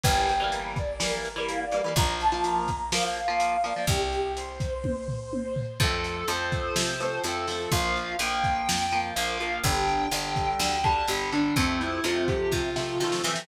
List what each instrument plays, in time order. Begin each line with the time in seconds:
0.04 electric bass (finger) G1, overdriven guitar E3 G3, brass section G5, kick, closed hi-hat
0.08 overdriven guitar A#3
0.29 closed hi-hat
0.40 overdriven guitar E3 G3 A#3
0.52 brass section A#4, closed hi-hat
0.76 brass section D5, kick, closed hi-hat
1.00 overdriven guitar E3 G3, brass section A#4, snare
1.04 overdriven guitar A#3
1.25 closed hi-hat
1.36 overdriven guitar E3 G3 A#3
1.48 brass section F5, closed hi-hat
1.61 brass section D5
1.72 overdriven guitar E3 G3, brass section D5, closed hi-hat
1.76 overdriven guitar A#3
1.84 overdriven guitar E3 G3 A#3
1.96 electric bass (finger) A#1, overdriven guitar F3 A#3, brass section A#5, kick, closed hi-hat
2.20 brass section A5, closed hi-hat
2.32 overdriven guitar F3 A#3, brass section A5
2.44 brass section A#5, closed hi-hat
2.68 kick, closed hi-hat
2.92 overdriven guitar F3 A#3, brass section F5, snare
3.04 brass section F5
3.16 closed hi-hat
3.28 overdriven guitar F3 A#3, brass section F5
3.40 closed hi-hat
3.64 overdriven guitar F3 A#3, brass section D5, closed hi-hat
3.76 overdriven guitar F3 A#3
3.87 electric bass (finger) C2, brass section G4, kick, closed hi-hat
4.12 closed hi-hat
4.36 brass section C5, closed hi-hat
4.60 kick, closed hi-hat
4.84 kick, high tom
5.08 floor tom
5.33 high tom
5.56 floor tom
5.80 electric bass (finger) F2, overdriven guitar F3 A3, distortion guitar A4, kick, crash
5.84 overdriven guitar C4
6.04 closed hi-hat
6.28 electric bass (finger) F2, overdriven guitar F3 A3, distortion guitar C5, closed hi-hat
6.32 overdriven guitar C4
6.52 kick, closed hi-hat
6.76 electric bass (finger) C3, snare
7.00 overdriven guitar F3 A3, closed hi-hat
7.04 overdriven guitar C4
7.24 electric bass (finger) F2, overdriven guitar F3 A3, distortion guitar A4, closed hi-hat
7.28 overdriven guitar C4
7.48 overdriven guitar F3 A3, open hi-hat
7.52 overdriven guitar C4
7.71 electric bass (finger) A#1, overdriven guitar F3 A#3, distortion guitar F5, kick, closed hi-hat
7.96 closed hi-hat
8.19 electric bass (finger) A#1, overdriven guitar F3 A#3, distortion guitar G5, closed hi-hat
8.44 kick, closed hi-hat
8.69 electric bass (finger) F2, snare
8.92 overdriven guitar F3 A#3, closed hi-hat
9.15 electric bass (finger) A#1, overdriven guitar F3 A#3, distortion guitar F5, closed hi-hat
9.40 overdriven guitar F3 A#3, closed hi-hat
9.63 electric bass (finger) G1, overdriven guitar D3 G3, distortion guitar G5, kick, closed hi-hat
9.88 closed hi-hat
10.11 electric bass (finger) G1, overdriven guitar D3 G3, closed hi-hat
10.36 kick, closed hi-hat
10.59 electric bass (finger) D2, distortion guitar G5, snare
10.84 overdriven guitar D3 G3, distortion guitar A5, kick, closed hi-hat
11.08 electric bass (finger) G1, overdriven guitar D3 G3, distortion guitar G4, closed hi-hat
11.32 overdriven guitar D3 G3, distortion guitar D4, closed hi-hat
11.56 electric bass (finger) F2, overdriven guitar C3 F3, distortion guitar C4, kick, closed hi-hat
11.60 overdriven guitar A3
11.80 distortion guitar E4, closed hi-hat
12.04 electric bass (finger) F2, overdriven guitar C3 F3 A3, distortion guitar F4, closed hi-hat
12.28 distortion guitar G4, kick, closed hi-hat
12.52 electric bass (finger) C3, distortion guitar F4, kick, snare
12.76 overdriven guitar C3 F3 A3, snare
13.00 overdriven guitar C3 F3 A3, electric bass (finger) D#3, snare
13.12 snare
13.24 overdriven guitar C3 F3, electric bass (finger) E3, snare
13.28 overdriven guitar A3
13.36 snare